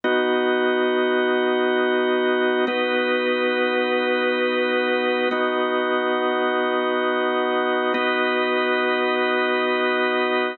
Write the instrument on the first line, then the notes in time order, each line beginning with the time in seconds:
drawbar organ
0.04 B3 D#4 F#4 D#5
2.67 B3 D#4 F#4 B4 D#5
5.31 B3 D#4 F#4 D#5
7.94 B3 D#4 F#4 B4 D#5